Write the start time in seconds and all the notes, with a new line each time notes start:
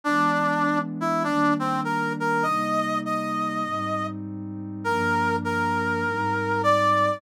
0.04 E3 G#3 B3 D4
1.01 E4
1.24 D#3 G3 A#3 D4
1.59 C4
1.84 A#4
2.20 A#4
2.43 C3 G3 A#3 D#4 D#5
3.06 D#5
3.64 G#2 G3 C4 D#4
4.84 G2 F3 A#3 D4 A#4
5.45 A#4
6.05 G#2 G3 C4 D#4
6.63 D5